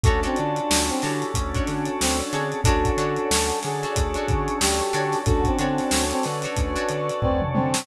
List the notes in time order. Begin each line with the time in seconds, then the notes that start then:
0.04 D2 A3 C#4 D4 F#4 A4 C#5, kick, closed hi-hat
0.23 C4 D4 F#4 A4 C#5, closed hi-hat
0.36 D3 D4 F4, closed hi-hat
0.56 closed hi-hat
0.70 D2, snare
0.89 C4, closed hi-hat
1.02 D3 D4 E4 F#4 G4 A4 C#5, snare, closed hi-hat
1.22 closed hi-hat
1.34 D2 A3 C#4 D4 A4 C#5, kick, closed hi-hat
1.55 D4 F#4 A4 C#5, kick, closed hi-hat
1.67 D3, snare, closed hi-hat
1.85 closed hi-hat
2.01 D2 C4, snare
2.20 closed hi-hat
2.32 D3 C4 D4 F#4 G#4 A4 C#5, closed hi-hat
2.52 closed hi-hat
2.64 D2 C#4 D4 F#4 A4 C#5 D5 F#5 A5, kick, closed hi-hat
2.85 kick, closed hi-hat
2.97 D3 D4 F#4 A4 C#5, closed hi-hat
3.16 closed hi-hat
3.31 D2, snare
3.50 closed hi-hat
3.63 D3 G#4, snare, closed hi-hat
3.83 D4 F#4 A4 C#5, closed hi-hat
3.96 D2 C#5 D5 A5 C#6, kick, closed hi-hat
4.14 D4 F#4 A4 C#5, closed hi-hat
4.28 D3, kick, closed hi-hat
4.48 closed hi-hat
4.60 D2 G4, snare
4.80 closed hi-hat
4.93 D3 D4 F#4 A4 C#5, closed hi-hat
5.12 snare, closed hi-hat
5.26 D2 C#4 D4 F#4 A4 C#5 D5 F#5 A5, kick, closed hi-hat
5.44 C4, kick, closed hi-hat
5.59 D3 C4 D4 F#4 A4 C#5, closed hi-hat
5.78 snare, closed hi-hat
5.91 D2 A4 C#5, snare
6.11 C4, closed hi-hat
6.23 D3 B4 D5, snare, closed hi-hat
6.42 D4 F#4 A4 C#5, closed hi-hat
6.56 D2 C#5 D5 A5 C#6, kick, closed hi-hat
6.76 D4 F#4 A4 C#5, closed hi-hat
6.89 D3, closed hi-hat
7.10 closed hi-hat
7.22 D2 C4 B4 D5, kick, floor tom
7.42 mid tom
7.54 D3 C4, high tom
7.74 snare